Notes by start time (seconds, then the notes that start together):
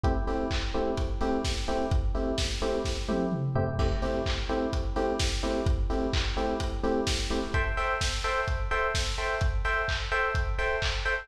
0.04 A3 C4 E4 G4, kick, closed hi-hat
0.27 A3 C4 E4 G4, open hi-hat
0.51 kick, clap
0.74 A3 C4 E4 G4, open hi-hat
0.97 kick, closed hi-hat
1.21 A3 C4 E4 G4, open hi-hat
1.45 kick, snare
1.68 A3 C4 E4 G4, open hi-hat
1.91 kick, closed hi-hat
2.15 A3 C4 E4 G4, open hi-hat
2.38 kick, snare
2.62 A3 C4 E4 G4, open hi-hat
2.85 kick, snare
3.08 A3 C4 E4 G4, high tom
3.32 mid tom
3.55 A3 C4 E4 G4, floor tom
3.79 A3 C4 E4 G4, kick, crash
4.02 A3 C4 E4 G4, open hi-hat
4.26 kick, clap
4.49 A3 C4 E4 G4, open hi-hat
4.73 kick, closed hi-hat
4.96 A3 C4 E4 G4, open hi-hat
5.19 kick, snare
5.43 A3 C4 E4 G4, open hi-hat
5.66 kick, closed hi-hat
5.90 A3 C4 E4 G4, open hi-hat
6.13 kick, clap
6.37 A3 C4 E4 G4, open hi-hat
6.60 kick, closed hi-hat
6.83 A3 C4 E4 G4, open hi-hat
7.07 kick, snare
7.30 A3 C4 E4 G4, open hi-hat
7.54 A4 C5 E5 G5, kick, closed hi-hat
7.77 A4 C5 E5 G5, open hi-hat
8.01 kick, snare
8.24 A4 C5 E5 G5, open hi-hat
8.48 kick, closed hi-hat
8.71 A4 C5 E5 G5, open hi-hat
8.95 kick, snare
9.18 A4 C5 E5 G5, open hi-hat
9.41 kick, closed hi-hat
9.65 A4 C5 E5 G5, open hi-hat
9.88 kick, clap
10.12 A4 C5 E5 G5, open hi-hat
10.35 kick, closed hi-hat
10.58 A4 C5 E5 G5, open hi-hat
10.82 kick, clap
11.05 A4 C5 E5 G5, open hi-hat